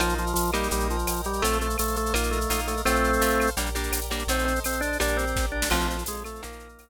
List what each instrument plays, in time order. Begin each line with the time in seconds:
0.00 synth bass 2 A#1, drawbar organ F3 A#4 D#5 F5, acoustic guitar (steel) A#3 D#4 F4, cowbell, claves, shaker
0.09 shaker
0.18 drawbar organ F3, shaker
0.27 shaker
0.34 synth bass 2 A#1, drawbar organ F3, tambourine, shaker
0.46 shaker
0.53 drawbar organ G3, acoustic guitar (steel) A#3 D#4 G4, claves, shaker
0.63 shaker
0.71 synth bass 2 A#1, drawbar organ G3 A#4 D#5 G5, cowbell, shaker
0.80 shaker
0.90 drawbar organ F3, shaker
0.99 shaker
1.07 synth bass 2 A#1, tambourine, cowbell, claves, shaker
1.16 shaker
1.24 drawbar organ G3, cowbell, shaker
1.33 shaker
1.42 synth bass 2 A#1, drawbar organ A3 A4 C5 F5, acoustic guitar (steel) A3 C4 F4, cowbell, shaker
1.53 shaker
1.61 drawbar organ A3, shaker
1.70 shaker
1.78 synth bass 2 A#1, drawbar organ A3, tambourine, claves, shaker
1.88 shaker
1.96 drawbar organ A3, shaker
2.06 shaker
2.13 synth bass 2 A#1, acoustic guitar (steel) A#3 D#4 F4, drawbar organ A#3 A#4 D#5 F5, cowbell, claves, shaker
2.23 shaker
2.31 drawbar organ A3, shaker
2.41 shaker
2.50 synth bass 2 A#1, acoustic guitar (steel) A#3 D#4 F4, tambourine, cowbell, shaker
2.59 shaker
2.67 drawbar organ A3, cowbell, shaker
2.77 shaker
2.85 synth bass 2 A#1, drawbar organ A3 C4 A4 C5 F5, acoustic guitar (steel) A3 C4 F4, cowbell, claves, shaker
2.96 shaker
3.04 shaker
3.13 shaker
3.20 synth bass 2 A#1, acoustic guitar (steel) A3 C4 F4, tambourine, shaker
3.30 shaker
3.40 claves, shaker
3.47 shaker
3.57 synth bass 2 A#1, acoustic guitar (steel) G3 A#3 D4, drawbar organ G4 A#4 D5, cowbell, shaker
3.66 shaker
3.75 acoustic guitar (steel) G3 A#3 D4, shaker
3.83 shaker
3.92 synth bass 2 A#1, tambourine, cowbell, claves, shaker
4.01 shaker
4.10 acoustic guitar (steel) G3 A#3 D4, cowbell, shaker
4.19 shaker
4.27 synth bass 2 A#1, acoustic guitar (steel) A3 C4 D#4, drawbar organ C4 A4 C5 D#5, cowbell, shaker
4.39 shaker
4.45 drawbar organ C4, shaker
4.56 shaker
4.64 synth bass 2 A#1, drawbar organ C4, tambourine, claves, shaker
4.72 shaker
4.81 drawbar organ D4, shaker
4.92 shaker
5.00 synth bass 2 A#1, acoustic guitar (steel) G3 A#3 D4, drawbar organ D4 G4 A#4 D5, cowbell, claves, shaker
5.08 shaker
5.17 drawbar organ C4, shaker
5.27 shaker
5.35 synth bass 2 A#1, kick, snare
5.52 drawbar organ D4
5.62 snare
5.70 synth bass 2 A#1, drawbar organ F3 C4 F4 A4, acoustic guitar (steel) F3 A3 C4, crash, cowbell, claves
5.80 shaker
5.88 drawbar organ F3, shaker
5.98 shaker
6.06 synth bass 2 A#1, drawbar organ G#3, tambourine, shaker
6.16 shaker
6.24 drawbar organ A3, claves, shaker
6.35 shaker
6.42 synth bass 2 A#1, acoustic guitar (steel) D#3 F3 A#3, drawbar organ A#3 D#4 F4 A#4, cowbell, shaker
6.52 shaker
6.59 shaker
6.69 shaker
6.78 synth bass 2 A#1, tambourine, cowbell, claves, shaker